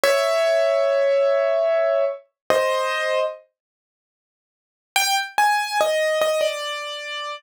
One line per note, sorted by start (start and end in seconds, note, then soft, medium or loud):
0.04 2.05 C#5 medium
0.04 2.05 E5 loud
2.50 3.20 C5 medium
2.50 3.20 D#5 medium
4.96 5.16 G5 loud
5.38 5.78 G#5 medium
5.81 6.19 D#5 loud
6.22 6.41 D#5 loud
6.41 7.36 D5 medium